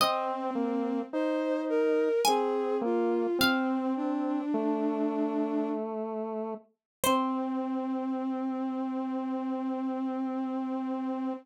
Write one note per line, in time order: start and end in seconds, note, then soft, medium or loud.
0.00 1.00 C4 loud
0.00 0.51 C4 loud
0.00 2.06 D#5 loud
0.55 1.02 A#3 medium
1.13 2.09 D#4 medium
1.13 1.61 C5 loud
1.69 2.21 A#4 loud
2.25 2.83 C4 loud
2.25 2.76 G#4 loud
2.25 3.20 G#5 medium
2.81 3.27 A#3 loud
2.81 3.38 F4 loud
3.39 4.41 C4 loud
3.39 3.93 C4 loud
3.39 5.37 F5 loud
3.96 5.69 D4 loud
4.54 6.54 A3 loud
7.04 11.33 C4 loud
7.04 11.31 C5 loud